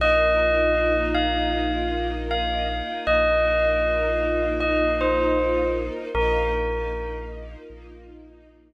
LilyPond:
<<
  \new Staff \with { instrumentName = "Tubular Bells" } { \time 4/4 \key bes \mixolydian \tempo 4 = 78 ees''4. f''4. f''4 | ees''2 ees''8 c''4 r8 | bes'4. r2 r8 | }
  \new Staff \with { instrumentName = "Synth Bass 2" } { \clef bass \time 4/4 \key bes \mixolydian bes,,1 | bes,,1 | bes,,2 bes,,2 | }
  \new Staff \with { instrumentName = "String Ensemble 1" } { \time 4/4 \key bes \mixolydian <bes ees' f'>1~ | <bes ees' f'>1 | <bes ees' f'>1 | }
>>